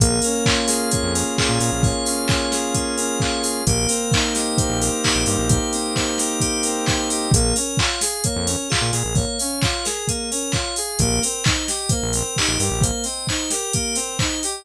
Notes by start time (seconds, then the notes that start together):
0.00 A#1 A#3 G#4, kick, closed hi-hat
0.22 C#4 A#4, open hi-hat
0.45 F4 C#5, kick, clap
0.67 G#4 F5, snare, open hi-hat
0.90 A#3 C#5, kick, closed hi-hat
1.03 F2
1.14 C#4 A#4, open hi-hat
1.37 F4 G#4, kick, clap
1.49 A#2
1.60 A#2 G#4 A#4, open hi-hat
1.72 A#1
1.82 A#3 C#5, kick, open hi-hat
2.05 C#4 F5, open hi-hat
2.28 F4 C#5, kick, clap
2.52 G#4 A#4, snare, open hi-hat
2.74 A#3 G#4, kick, closed hi-hat
2.97 C#4 A#4, open hi-hat
3.20 F4 C#5, kick, clap
3.43 G#4 F5, open hi-hat
3.67 A#1 A#3 G4, kick, closed hi-hat
3.88 C4 A#4, open hi-hat
4.12 D#4 C5, kick, clap
4.33 G4 D#5, snare, open hi-hat
4.58 A#3 C5, kick, closed hi-hat
4.70 A#1
4.81 C4 A#4, open hi-hat
5.03 D#4 G4, kick, clap
5.15 A#1
5.26 G2 G4 A#4, open hi-hat
5.38 A#1
5.49 A#3 C5, kick, closed hi-hat
5.73 C4 D#5, open hi-hat
5.95 D#4 C5, kick, clap
6.18 G4 A#4, snare, open hi-hat
6.40 A#3 G4, kick, closed hi-hat
6.63 C4 A#4, open hi-hat
6.86 D#4 C5, kick, clap
7.09 G4 D#5, open hi-hat
7.31 A#1 A#3 G#4, kick, closed hi-hat
7.56 C#4 A#4, open hi-hat
7.77 F4 C#5, kick, clap
8.01 G#4 F5, snare, open hi-hat
8.24 A#3 C#5, kick, closed hi-hat
8.36 F2
8.46 C#4 A#4, open hi-hat
8.69 F4 G#4, kick, clap
8.81 A#2
8.91 A#2 G#4 A#4, open hi-hat
9.04 A#1
9.15 A#3 C#5, kick, open hi-hat
9.39 C#4 F5, open hi-hat
9.62 F4 C#5, kick, clap
9.84 G#4 A#4, snare, open hi-hat
10.08 A#3 G#4, kick, closed hi-hat
10.31 C#4 A#4, open hi-hat
10.52 F4 C#5, kick, clap
10.76 G#4 F5, open hi-hat
10.99 A#1 A#3 G4, kick, closed hi-hat
11.22 C4 A#4, open hi-hat
11.44 D#4 C5, kick, clap
11.68 G4 D#5, snare, open hi-hat
11.89 A#3 C5, kick, closed hi-hat
12.02 A#1
12.13 C4 A#4, open hi-hat
12.36 D#4 G4, kick, clap
12.48 A#1
12.59 G2 G4 A#4, open hi-hat
12.71 A#1
12.81 A#3 C5, kick, closed hi-hat
13.04 C4 D#5, open hi-hat
13.27 D#4 C5, kick, clap
13.50 G4 A#4, snare, open hi-hat
13.73 A#3 G4, kick, closed hi-hat
13.95 C4 A#4, open hi-hat
14.19 D#4 C5, kick, clap
14.43 G4 D#5, open hi-hat